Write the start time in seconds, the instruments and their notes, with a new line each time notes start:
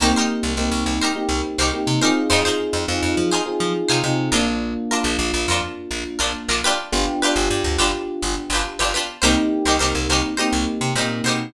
0.00 electric bass (finger) C2, electric piano 1 A#3 C4 D#4 G4, pizzicato strings D#4 G4 A#4 C5
0.16 pizzicato strings D#4 G4 A#4 C5
0.43 electric bass (finger) C2
0.57 electric bass (finger) C2, electric piano 1 A#3 C4 D#4 G4
0.72 electric bass (finger) C2
0.86 electric bass (finger) C2
1.01 pizzicato strings D#4 G4 A#4 C5
1.15 electric piano 1 A#3 C4 D#4 G4
1.29 electric bass (finger) C2
1.58 electric bass (finger) C2, pizzicato strings D#4 G4 A#4 C5
1.73 electric piano 1 A#3 C4 D#4 G4
1.87 electric bass (finger) C3
2.01 electric piano 1 C4 D#4 F4 G#4, pizzicato strings D#4 G4 A#4 C5
2.30 electric bass (finger) F2, pizzicato strings D#4 F4 G#4 C5
2.45 pizzicato strings D#4 F4 G#4 C5
2.73 electric bass (finger) F2
2.88 electric bass (finger) F2, electric piano 1 C4 D#4 F4 G#4
3.03 electric bass (finger) F2
3.17 electric bass (finger) F3
3.31 pizzicato strings D#4 F4 G#4 C5
3.46 electric piano 1 C4 D#4 F4 G#4
3.60 electric bass (finger) F3
3.88 electric bass (finger) C3, pizzicato strings D#4 F4 G#4 C5
4.04 electric bass (finger) C3, electric piano 1 C4 D#4 F4 G#4
4.32 electric bass (finger) A#1, electric piano 1 A#3 D4 F4, pizzicato strings D4 F4 A#4
4.91 pizzicato strings D4 F4 A#4
5.04 electric bass (finger) A#1
5.19 electric bass (finger) A#1
5.34 electric bass (finger) A#1
5.48 electric bass (finger) F2, pizzicato strings D4 F4 A#4
5.91 electric bass (finger) A#1
6.19 electric bass (finger) A#1, pizzicato strings D4 F4 A#4
6.48 electric bass (finger) A#1, pizzicato strings D4 F4 A#4
6.64 pizzicato strings D4 F4 G4 B4
6.92 electric bass (finger) G1, electric piano 1 B3 D4 F4 G4
7.22 pizzicato strings D4 F4 G4 B4
7.36 electric bass (finger) G1
7.50 electric bass (finger) G2
7.64 electric bass (finger) D2
7.78 electric bass (finger) G1, pizzicato strings D4 F4 G4 B4
8.22 electric bass (finger) G1
8.50 electric bass (finger) G1, pizzicato strings G4 B4
8.55 pizzicato strings D4 F4
8.79 electric bass (finger) G1, pizzicato strings D4 F4 G4 B4
8.94 pizzicato strings D4 F4 G4 B4
9.22 electric bass (finger) C2, electric piano 1 A#3 C4 D#4 G4, pizzicato strings D#4 G4 A#4 C5
9.65 electric bass (finger) C2, pizzicato strings D#4 G4 A#4 C5
9.79 electric bass (finger) C2, electric piano 1 A#3 C4 D#4 G4, pizzicato strings D#4 G4 A#4 C5
9.95 electric bass (finger) C2
10.09 electric bass (finger) C2, pizzicato strings D#4 G4 A#4 C5
10.37 electric piano 1 A#3 C4 D#4 G4, pizzicato strings D#4 G4 A#4 C5
10.53 electric bass (finger) C2
10.81 electric bass (finger) C3
10.95 electric bass (finger) A#2, electric piano 1 A#3 C4 D#4 G4, pizzicato strings D#4 G4 A#4 C5
11.24 electric bass (finger) B2, pizzicato strings A#4 C5
11.28 pizzicato strings D#4 G4